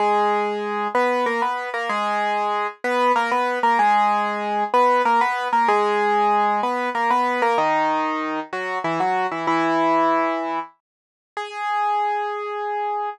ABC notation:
X:1
M:3/4
L:1/16
Q:1/4=95
K:G#m
V:1 name="Acoustic Grand Piano"
[G,G]6 [B,B]2 [A,A] [B,B]2 [A,A] | [G,G]6 [B,B]2 [A,A] [B,B]2 [A,A] | [G,G]6 [B,B]2 [A,A] [B,B]2 [A,A] | [G,G]6 [B,B]2 [A,A] [B,B]2 [A,A] |
[D,D]6 [F,F]2 [E,E] [F,F]2 [E,E] | [E,E]8 z4 | G12 |]